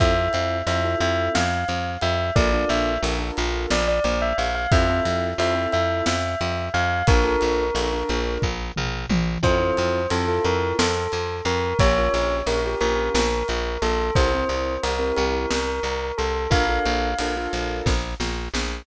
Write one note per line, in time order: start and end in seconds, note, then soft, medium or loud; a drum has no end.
0.00 0.29 F2 medium
0.00 0.13 C4 loud
0.00 0.13 E4 medium
0.00 0.13 F4 medium
0.00 0.13 A4 loud
0.00 0.57 E5 loud
0.00 kick loud
0.00 ride medium
0.17 0.58 C4 medium
0.17 0.58 E4 medium
0.17 0.58 F4 medium
0.17 0.58 A4 medium
0.33 0.62 F2 medium
0.33 ride medium
0.67 0.95 F2 medium
0.67 0.81 C4 medium
0.67 0.81 E4 medium
0.67 0.81 F4 medium
0.67 0.81 A4 medium
0.67 0.97 E5 loud
0.67 ride medium
0.84 1.38 C4 medium
0.84 1.38 E4 medium
0.84 1.38 F4 medium
0.84 1.38 A4 medium
1.00 1.29 F2 medium
1.00 1.29 E5 loud
1.00 ride medium
1.35 1.64 F2 medium
1.35 1.90 F5 medium
1.35 snare loud
1.68 1.97 F2 medium
1.68 ride medium
2.01 2.31 F2 medium
2.01 2.30 E5 medium
2.01 ride medium
2.36 2.65 A#1 medium
2.36 2.49 D4 medium
2.36 2.49 F4 medium
2.36 2.49 A4 medium
2.36 2.49 A#4 loud
2.36 2.69 D5 loud
2.36 kick loud
2.36 ride loud
2.53 2.94 D4 medium
2.53 2.94 F4 medium
2.53 2.94 A4 medium
2.53 2.94 A#4 medium
2.69 2.98 A#1 medium
2.69 2.97 E5 medium
2.69 ride medium
3.03 3.31 A#1 medium
3.03 3.16 D4 medium
3.03 3.16 F4 medium
3.03 3.16 A4 medium
3.03 3.16 A#4 medium
3.03 ride loud
3.19 3.73 D4 medium
3.19 3.73 F4 medium
3.19 3.73 A4 medium
3.19 3.73 A#4 medium
3.37 3.66 A#1 medium
3.37 ride medium
3.71 4.00 A#1 medium
3.71 3.87 D5 medium
3.71 snare loud
3.88 4.04 D5 loud
4.04 4.33 A#1 medium
4.04 4.21 D5 medium
4.04 ride medium
4.22 4.38 E5 medium
4.38 4.67 A#1 medium
4.38 4.54 F5 medium
4.38 ride medium
4.55 4.71 F5 loud
4.71 5.01 F2 medium
4.71 4.86 C4 loud
4.71 4.86 E4 medium
4.71 4.86 F4 loud
4.71 4.86 A4 loud
4.71 5.26 E5 loud
4.71 kick loud
4.71 ride loud
4.90 5.30 C4 medium
4.90 5.30 E4 medium
4.90 5.30 F4 medium
4.90 5.30 A4 medium
5.05 5.34 F2 medium
5.05 ride medium
5.38 5.67 F2 medium
5.38 5.53 C4 medium
5.38 5.53 E4 medium
5.38 5.53 F4 medium
5.38 5.53 A4 medium
5.38 5.68 E5 loud
5.38 ride loud
5.55 6.09 C4 medium
5.55 6.09 E4 medium
5.55 6.09 F4 medium
5.55 6.09 A4 medium
5.72 6.02 F2 medium
5.72 6.03 E5 medium
5.72 ride medium
6.06 6.35 F2 medium
6.06 6.65 E5 medium
6.06 snare loud
6.41 6.69 F2 medium
6.41 ride medium
6.74 7.03 F2 medium
6.74 7.04 F5 loud
6.74 ride medium
7.07 7.36 A#1 medium
7.07 7.22 D4 loud
7.07 7.22 F4 loud
7.07 7.22 A4 loud
7.07 8.34 A#4 loud
7.07 7.22 A#4 medium
7.07 kick loud
7.07 ride loud
7.24 7.65 D4 medium
7.24 7.65 F4 medium
7.24 7.65 A4 medium
7.24 7.65 A#4 medium
7.41 7.71 A#1 medium
7.41 ride medium
7.74 8.03 A#1 medium
7.74 7.88 D4 medium
7.74 7.88 F4 medium
7.74 7.88 A4 medium
7.74 7.88 A#4 medium
7.74 ride loud
7.93 8.47 D4 medium
7.93 8.47 F4 medium
7.93 8.47 A4 medium
7.93 8.47 A#4 medium
8.09 8.38 A#1 medium
8.09 ride medium
8.42 8.72 A#1 medium
8.42 kick medium
8.76 9.06 A#1 medium
8.76 mid tom medium
9.09 9.38 A#1 medium
9.09 high tom loud
9.43 9.71 F2 medium
9.43 9.56 C4 medium
9.43 9.56 E4 loud
9.43 9.56 F4 loud
9.43 9.56 A4 loud
9.43 10.06 C5 loud
9.43 kick medium
9.43 crash loud
9.60 10.00 C4 medium
9.60 10.00 E4 medium
9.60 10.00 F4 medium
9.60 10.00 A4 medium
9.77 10.07 F2 medium
9.77 ride medium
10.10 10.39 F2 medium
10.10 10.25 C4 medium
10.10 10.25 E4 medium
10.10 10.25 F4 medium
10.10 10.43 A4 medium
10.10 10.25 A4 medium
10.10 ride loud
10.28 10.82 C4 medium
10.28 10.82 E4 medium
10.28 10.82 F4 medium
10.28 10.82 A4 medium
10.45 10.73 F2 medium
10.45 10.74 A#4 medium
10.45 ride medium
10.79 11.07 F2 medium
10.79 11.35 A4 medium
10.79 snare loud
11.12 11.41 F2 medium
11.12 ride medium
11.45 11.74 F2 medium
11.45 11.78 A#4 medium
11.45 ride medium
11.79 12.09 A#1 medium
11.79 11.93 C#4 medium
11.79 11.93 F4 medium
11.79 11.93 G4 loud
11.79 11.93 A#4 medium
11.79 12.35 C#5 loud
11.79 kick loud
11.79 ride loud
11.98 12.38 C#4 medium
11.98 12.38 F4 medium
11.98 12.38 G4 medium
11.98 12.38 A#4 medium
12.14 12.42 A#1 medium
12.14 ride medium
12.46 12.75 A#1 medium
12.46 12.61 C#4 medium
12.46 12.61 F4 medium
12.46 12.61 G4 medium
12.46 12.61 A#4 medium
12.46 12.76 A#4 medium
12.46 ride loud
12.65 13.19 C#4 medium
12.65 13.19 F4 medium
12.65 13.19 G4 medium
12.65 13.19 A#4 medium
12.81 13.10 A#1 medium
12.81 13.11 A#4 medium
12.81 ride medium
13.14 13.43 A#1 medium
13.14 13.76 A#4 medium
13.14 snare loud
13.48 13.78 A#1 medium
13.48 ride medium
13.82 14.11 A#1 medium
13.82 14.11 A4 loud
13.82 ride medium
14.15 14.45 C2 medium
14.15 14.30 C4 medium
14.15 14.30 E4 medium
14.15 14.30 G4 medium
14.15 14.30 A#4 medium
14.15 14.74 C5 loud
14.15 kick loud
14.15 ride loud
14.34 14.75 C4 medium
14.34 14.75 E4 medium
14.34 14.75 G4 medium
14.34 14.75 A#4 medium
14.49 14.78 C2 medium
14.49 ride medium
14.83 15.12 C2 medium
14.83 14.97 C4 medium
14.83 14.97 E4 medium
14.83 14.97 G4 medium
14.83 15.14 A#4 medium
14.83 14.97 A#4 medium
14.83 ride loud
14.99 15.53 C4 medium
14.99 15.53 E4 medium
14.99 15.53 G4 medium
14.99 15.53 A#4 medium
15.17 15.46 C2 medium
15.17 15.49 A#4 medium
15.17 ride medium
15.51 15.80 C2 medium
15.51 16.12 A#4 medium
15.51 snare loud
15.83 16.12 C2 medium
15.83 ride medium
16.18 16.47 C2 medium
16.18 16.46 A4 medium
16.18 ride medium
16.50 16.79 A#1 medium
16.50 16.64 D4 medium
16.50 16.64 F4 medium
16.50 16.64 A4 medium
16.50 16.64 A#4 loud
16.50 17.76 F5 loud
16.50 kick loud
16.50 ride loud
16.69 17.10 D4 medium
16.69 17.10 F4 medium
16.69 17.10 A4 medium
16.69 17.10 A#4 medium
16.86 17.14 A#1 medium
16.86 ride medium
17.19 17.48 A#1 medium
17.19 17.34 D4 medium
17.19 17.34 F4 medium
17.19 17.34 A4 medium
17.19 17.34 A#4 medium
17.19 ride loud
17.37 17.91 D4 medium
17.37 17.91 F4 medium
17.37 17.91 A4 medium
17.37 17.91 A#4 medium
17.53 17.82 A#1 medium
17.53 ride medium
17.86 18.15 A#1 medium
17.86 kick medium
17.86 snare medium
18.20 18.48 A#1 medium
18.20 snare medium
18.54 18.82 A#1 medium
18.54 snare loud